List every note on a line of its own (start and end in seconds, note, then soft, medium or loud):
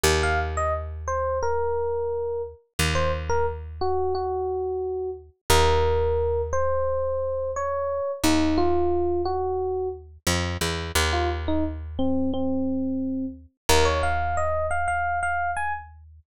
0.03 2.54 D#2 medium
0.23 0.39 F5 loud
0.57 0.73 D#5 loud
1.08 1.38 C5 medium
1.42 2.42 A#4 medium
2.79 5.30 D#2 medium
2.95 3.11 C5 medium
3.29 3.46 A#4 loud
3.81 4.13 F#4 medium
4.15 5.10 F#4 medium
5.50 8.01 D#2 medium
5.50 6.41 A#4 loud
6.53 7.51 C5 medium
7.56 8.11 C#5 medium
8.23 10.18 D#2 medium
8.23 8.57 D#4 loud
8.58 9.21 F4 loud
9.25 9.88 F#4 medium
10.27 10.57 F2 medium
10.61 10.92 E2 medium
10.95 13.46 D#2 medium
11.13 11.29 F4 medium
11.48 11.64 D#4 medium
11.99 12.31 C4 medium
12.34 13.26 C4 medium
13.69 16.20 D#2 medium
13.69 13.85 A#4 loud
13.85 14.01 C#5 medium
14.03 14.36 F5 medium
14.37 14.66 D#5 medium
14.71 14.87 F5 medium
14.88 15.19 F5 medium
15.23 15.51 F5 medium
15.56 15.73 G#5 medium